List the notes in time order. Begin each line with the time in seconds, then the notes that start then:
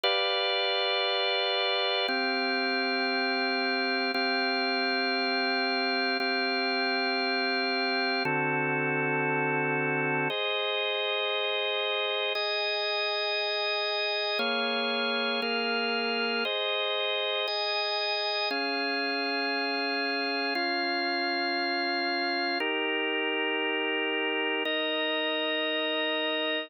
0.04 G4 B4 D5 F5
2.08 C4 G4 F5
4.14 C4 G4 F5
6.20 C4 G4 F5
8.25 D3 C4 F#4 A4
10.30 G#4 C5 D#5
12.35 G#4 D#5 G#5
14.39 A#3 G#4 C#5 F5
15.42 A#3 G#4 A#4 F5
16.45 G#4 C5 D#5
17.48 G#4 D#5 G#5
18.51 C#4 G#4 F5
20.55 C#4 F4 F5
22.60 D#4 G4 A#4
24.65 D#4 A#4 D#5